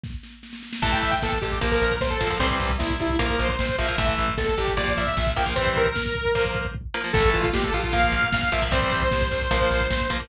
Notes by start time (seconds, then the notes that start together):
0.04 kick, snare
0.23 snare
0.43 snare
0.53 snare
0.63 snare
0.73 snare
0.82 A1 E3 A3 A5, kick, crash
0.92 G5, kick
1.02 A1 E5, kick, closed hi-hat
1.11 G5, kick
1.22 A1 A4, kick, snare
1.32 kick
1.41 A1 G4, kick, closed hi-hat
1.52 kick
1.61 A#1 F3 A#3, kick, closed hi-hat
1.71 A#4, kick
1.81 A#1, kick, closed hi-hat
1.91 kick
2.01 A#1 C5, kick, snare
2.10 A4, kick
2.21 A#1 F3 A#3, kick, closed hi-hat
2.31 F3 A#3, kick
2.39 C2 E3 G3 C4 C5, kick, closed hi-hat
2.50 kick
2.60 C2, kick, closed hi-hat
2.70 kick
2.79 C2 E4, kick, snare
2.90 kick
3.00 C2 E4, kick, closed hi-hat
3.10 kick
3.19 A#1 F3 A#3 A#4, kick, closed hi-hat
3.29 kick
3.39 A#1 C5, kick, closed hi-hat
3.49 C5, kick
3.59 A#1, kick, snare
3.69 kick
3.78 A#1 F3 A#3 E5, kick, closed hi-hat
3.88 F3 A#3, kick
3.98 A1 E3 A3 E5, kick, closed hi-hat
4.08 kick
4.18 A1, kick, closed hi-hat
4.28 kick
4.37 A1 A4, kick, snare
4.48 kick
4.57 A1 G4, kick, closed hi-hat
4.67 kick
4.77 A#1 F3 A#3 D5, kick, closed hi-hat
4.87 kick
4.97 A#1 E5, kick, closed hi-hat
5.06 E5, kick
5.17 A#1, kick, snare
5.27 kick
5.36 A#1 F3 A#3 G5, kick, closed hi-hat
5.46 F3 A#3, kick
5.56 E3 G3 C4 C5, kick, closed hi-hat
5.66 kick
5.76 A#4, kick, closed hi-hat
5.86 kick
5.96 kick, snare
6.06 kick
6.15 kick, closed hi-hat
6.25 kick
6.35 F3 A#3, kick, closed hi-hat
6.45 kick
6.55 kick, closed hi-hat
6.65 kick
6.75 kick
6.94 F3 A#3
7.04 F3 A#3
7.13 A1 E3 A3 A4, kick, crash
7.24 kick
7.33 A1 F4, kick, closed hi-hat
7.42 F4, kick
7.53 A1 G4, kick, snare
7.63 A4, kick
7.73 A#1 F4, kick, closed hi-hat
7.83 F4, kick
7.93 F3 A#3 F5, kick, closed hi-hat
8.03 kick
8.12 A#1, kick, closed hi-hat
8.23 kick
8.32 A#1 F5, kick, snare
8.42 kick
8.52 A#1 F3 A#3 E5, kick, closed hi-hat
8.62 F3 A#3, kick
8.71 C2 E3 G3 C4 C5, kick, closed hi-hat
8.82 kick
8.92 C2, kick, closed hi-hat
9.02 kick
9.11 C2, kick, snare
9.21 kick
9.31 C2, kick, closed hi-hat
9.41 kick
9.51 A#1 F3 A#3, kick, closed hi-hat
9.61 kick
9.70 A#1, kick, closed hi-hat
9.80 kick
9.90 A#1, kick, snare
10.00 kick
10.10 A#1 F3 A#3, kick, closed hi-hat
10.20 F3 A#3, kick